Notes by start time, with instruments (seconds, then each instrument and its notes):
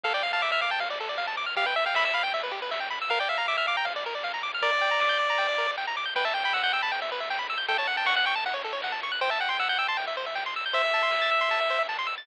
0.04 synth bass 1 D2, lead 1 (square) A4 F5, kick, crash
0.14 lead 1 (square) D5 G5
0.23 lead 1 (square) F5, ride
0.33 lead 1 (square) F5 A5
0.42 lead 1 (square) E5 D6, kick, clap
0.52 lead 1 (square) E5 F6
0.61 lead 1 (square) F5 D6, ride
0.71 lead 1 (square) G5 A5
0.79 lead 1 (square) F5, kick, ride
0.90 lead 1 (square) D5
1.00 lead 1 (square) A4, ride
1.09 lead 1 (square) D5
1.18 lead 1 (square) F5, kick, clap
1.27 lead 1 (square) A5
1.37 lead 1 (square) D6, snare, ride
1.46 lead 1 (square) F6
1.56 synth bass 1 E2, lead 1 (square) G4 F5, kick, ride
1.66 lead 1 (square) B4 G5
1.76 lead 1 (square) E5, ride
1.86 lead 1 (square) F5 G5
1.94 lead 1 (square) E5 B5, kick, snare
2.05 lead 1 (square) E5 E6
2.14 lead 1 (square) F5 B5, ride
2.23 lead 1 (square) G5
2.34 lead 1 (square) E5, kick, ride
2.43 lead 1 (square) B4
2.52 lead 1 (square) G4, ride
2.62 lead 1 (square) B4
2.71 lead 1 (square) E5, kick, snare
2.80 lead 1 (square) G5
2.90 lead 1 (square) B5, snare, ride
3.02 lead 1 (square) E6
3.08 synth bass 1 A#1, lead 1 (square) A#4 F5, kick, ride
3.19 lead 1 (square) D5 G5
3.29 lead 1 (square) E5 F5, ride
3.38 lead 1 (square) F5 A#5
3.48 lead 1 (square) E5 D6, kick, snare
3.57 lead 1 (square) E5 F6
3.67 lead 1 (square) F5 D6, ride
3.77 lead 1 (square) G5 A#5
3.85 lead 1 (square) F5, kick, ride
3.96 lead 1 (square) D5
4.04 lead 1 (square) A#4, ride
4.15 lead 1 (square) D5
4.23 lead 1 (square) F5, kick, snare
4.34 lead 1 (square) A#5
4.43 lead 1 (square) D6, snare, ride
4.54 lead 1 (square) F6
4.62 synth bass 1 G1, lead 1 (square) A#4 D5, kick, ride
4.73 lead 1 (square) D5
4.81 lead 1 (square) G5, ride
4.91 lead 1 (square) A#5
5.00 lead 1 (square) D6, kick, snare
5.09 lead 1 (square) G6
5.19 lead 1 (square) D6, ride
5.30 lead 1 (square) A#5
5.37 lead 1 (square) G5, kick, ride
5.49 lead 1 (square) D5
5.58 lead 1 (square) A#4, ride
5.68 lead 1 (square) D5
5.77 lead 1 (square) G5, kick, clap
5.87 lead 1 (square) A#5
5.96 lead 1 (square) D6, snare, ride
6.05 lead 1 (square) G6
6.15 synth bass 1 E2, lead 1 (square) B4 G5, kick, crash
6.25 lead 1 (square) E5 A5
6.34 lead 1 (square) G5, ride
6.44 lead 1 (square) G5 B5
6.53 lead 1 (square) F#5 E6, kick, clap
6.63 lead 1 (square) F#5 G6
6.73 lead 1 (square) G5 E6, ride
6.82 lead 1 (square) A5 B5
6.91 lead 1 (square) G5, kick, ride
7.02 lead 1 (square) E5
7.09 lead 1 (square) B4, ride
7.20 lead 1 (square) E5
7.28 lead 1 (square) G5, kick, clap
7.39 lead 1 (square) B5
7.49 lead 1 (square) E6, snare, ride
7.58 lead 1 (square) G6
7.68 synth bass 1 F#2, lead 1 (square) A4 G5, kick, ride
7.78 lead 1 (square) C#5 A5
7.87 lead 1 (square) F#5, ride
7.97 lead 1 (square) G5 A5
8.06 lead 1 (square) F#5 C#6, kick, snare
8.16 lead 1 (square) F#5 F#6
8.26 lead 1 (square) G5 C#6, ride
8.35 lead 1 (square) A5
8.44 lead 1 (square) F#5, kick, ride
8.54 lead 1 (square) C#5
8.63 lead 1 (square) A4, ride
8.73 lead 1 (square) C#5
8.82 lead 1 (square) F#5, kick, snare
8.92 lead 1 (square) A5
9.02 lead 1 (square) C#6, snare, ride
9.12 lead 1 (square) F#6
9.21 synth bass 1 C2, lead 1 (square) C5 G5, kick, ride
9.30 lead 1 (square) E5 A5
9.40 lead 1 (square) F#5 G5, ride
9.49 lead 1 (square) G5 C6
9.59 lead 1 (square) F#5 E6, kick, snare
9.69 lead 1 (square) F#5 G6
9.78 lead 1 (square) G5 E6, ride
9.88 lead 1 (square) A5 C6
9.97 lead 1 (square) G5, kick, ride
10.07 lead 1 (square) E5
10.17 lead 1 (square) C5, ride
10.26 lead 1 (square) E5
10.35 lead 1 (square) G5, kick, snare
10.46 lead 1 (square) C6
10.56 lead 1 (square) E6, snare, ride
10.66 lead 1 (square) G6
10.73 synth bass 1 A1, lead 1 (square) C5 E5, kick, ride
10.85 lead 1 (square) E5
10.94 lead 1 (square) A5, ride
11.03 lead 1 (square) C6
11.11 lead 1 (square) E6, kick, snare
11.22 lead 1 (square) A6
11.31 lead 1 (square) E6, ride
11.41 lead 1 (square) C6
11.50 lead 1 (square) A5, kick, ride
11.61 lead 1 (square) E5
11.68 lead 1 (square) C5, ride
11.79 lead 1 (square) E5
11.89 lead 1 (square) A5, kick, clap
11.99 lead 1 (square) C6
12.07 lead 1 (square) E6, snare, ride
12.18 lead 1 (square) A6